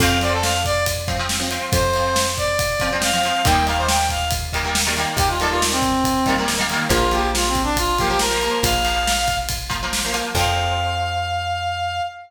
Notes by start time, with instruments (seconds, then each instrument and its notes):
0.00 electric bass (finger) F2, acoustic guitar (steel) F3 C4, brass section F5, kick, crash
0.21 acoustic guitar (steel) F3 C4, brass section D5, ride
0.32 brass section A4
0.42 brass section F5, snare
0.65 brass section D5, kick, ride
0.86 kick, ride
1.08 acoustic guitar (steel) F3 C4, kick, ride
1.19 acoustic guitar (steel) F3 C4
1.29 snare
1.40 acoustic guitar (steel) F3 C4
1.51 acoustic guitar (steel) F3 C4, ride
1.72 electric bass (finger) F2, brass section C5, kick, ride
1.94 acoustic guitar (steel) F3 C4, ride
2.16 snare
2.37 brass section D5, kick, ride
2.59 kick, ride
2.80 acoustic guitar (steel) F3 C4, kick, ride
2.92 acoustic guitar (steel) F3 C4
3.02 brass section F5, snare
3.13 acoustic guitar (steel) F3 C4
3.23 acoustic guitar (steel) F3 C4, ride
3.45 electric bass (finger) D#2, acoustic guitar (steel) D#3 G3 A#3, brass section G5, kick, ride
3.66 acoustic guitar (steel) D#3 G3 A#3, brass section F5, ride
3.77 brass section C5
3.88 brass section G5, snare
4.09 brass section F5, kick, ride
4.31 kick, ride
4.53 acoustic guitar (steel) D#3 G3 A#3, kick, ride
4.63 acoustic guitar (steel) D#3 G3 A#3
4.75 snare
4.87 acoustic guitar (steel) D#3 G3 A#3
4.97 acoustic guitar (steel) D#3 G3 A#3, ride
5.17 electric bass (finger) D#2, brass section G4, kick, ride
5.29 brass section F4
5.40 acoustic guitar (steel) D#3 G3 A#3, brass section A4, ride
5.50 brass section F4
5.62 snare
5.71 brass section C4
5.82 kick, ride
6.04 kick, ride
6.26 acoustic guitar (steel) D#3 G3 A#3, kick, ride
6.38 acoustic guitar (steel) D#3 G3 A#3
6.48 snare
6.58 acoustic guitar (steel) D#3 G3 A#3
6.70 acoustic guitar (steel) D#3 G3 A#3, ride
6.89 electric bass (finger) A#1, acoustic guitar (steel) F3 A#3, brass section F4, kick, ride
7.11 acoustic guitar (steel) F3 A#3, brass section G4, ride
7.34 brass section F4, snare
7.48 brass section C4
7.55 kick, ride
7.63 brass section D4
7.76 brass section F4, kick, ride
7.98 acoustic guitar (steel) F3 A#3, brass section G4, kick, ride
8.09 acoustic guitar (steel) F3 A#3, brass section G4
8.19 brass section A#4, snare
8.31 acoustic guitar (steel) F3 A#3
8.41 acoustic guitar (steel) F3 A#3, ride
8.63 electric bass (finger) A#1, brass section F5, kick, ride
8.85 acoustic guitar (steel) F3 A#3, ride
9.07 snare
9.28 kick, ride
9.49 kick, ride
9.70 acoustic guitar (steel) F3 A#3, kick, ride
9.83 acoustic guitar (steel) F3 A#3
9.93 snare
10.04 acoustic guitar (steel) F3 A#3
10.13 acoustic guitar (steel) F3 A#3, ride
10.35 electric bass (finger) F2, acoustic guitar (steel) F3 C4, brass section F5, kick, crash